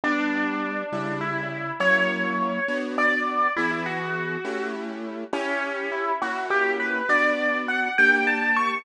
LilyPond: <<
  \new Staff \with { instrumentName = "Acoustic Grand Piano" } { \time 6/8 \key d \major \tempo 4. = 68 d'2 e'4 | cis''2 d''4 | e'16 e'16 fis'4. r4 | cis'4 e'8 fis'8 g'8 b'8 |
d''4 fis''8 g''8 a''8 cis'''8 | }
  \new Staff \with { instrumentName = "Acoustic Grand Piano" } { \time 6/8 \key d \major <g b d'>4. <cis g e'>4. | <fis ais cis' e'>4. <b d' fis'>4. | <e b gis'>4. <a cis' e' g'>4. | <cis' e' g'>4. <ais cis' e' fis'>4. |
<b d' fis'>4. <bes d' g'>4. | }
>>